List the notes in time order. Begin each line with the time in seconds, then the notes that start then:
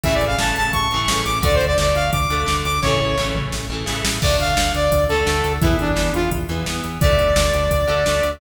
0.04 A1 C#3 E3 A3 E5, kick, closed hi-hat
0.14 D5
0.21 A1, closed hi-hat
0.27 F5
0.38 A1 C#3 E3 A5, snare
0.43 A3
0.56 A1 A5, closed hi-hat
0.73 A1 C#6, kick, closed hi-hat
0.91 A1 C#3 E3, closed hi-hat
0.96 A3
1.08 A1 C#3 E3 A3, snare
1.25 A1 D6, closed hi-hat
1.42 D2 D3 A3 D5, kick, closed hi-hat
1.55 C5
1.61 D2, closed hi-hat
1.66 D5
1.78 D2 D3 A3 D5, snare
1.95 D2 F5, closed hi-hat
2.12 D2 D6, kick, closed hi-hat
2.30 D2 D3 A3, closed hi-hat
2.46 D2 D3 A3, snare
2.64 D2 D6, closed hi-hat
2.82 A1 C#3 E3 C#5, kick, snare
2.87 A3
3.00 A1
3.17 A1 C#3 E3 A3, snare
3.35 A1, mid tom
3.52 A1, snare
3.70 A1 C#3 E3 A3
3.86 A1 C#3 E3 A3, snare
4.05 A1, snare
4.22 D2 D3 A3 D5, kick, crash
4.40 D2 F5, closed hi-hat
4.57 D2 D3 A3, snare
4.74 D2 D5, closed hi-hat
4.92 D2, kick, closed hi-hat
5.09 D2 D3 A3 A4, closed hi-hat
5.26 D2 D3 A3, snare
5.44 D2, closed hi-hat
5.61 E2 E3 B3 E4, kick, closed hi-hat
5.79 E2 D4, closed hi-hat
5.96 E2 E3 B3, snare
6.14 E2 F4, closed hi-hat
6.31 E2, kick, closed hi-hat
6.49 E2 E3 B3, closed hi-hat
6.66 E2 E3 B3, snare
6.84 E2, closed hi-hat
7.01 D2 D3 A3 D5, kick, closed hi-hat
7.19 D2, closed hi-hat
7.36 D2 D3 A3, snare
7.53 D2, closed hi-hat
7.71 D2, kick, closed hi-hat
7.87 D2 D3 A3, closed hi-hat
8.06 D2 D3 A3, snare
8.23 D2, closed hi-hat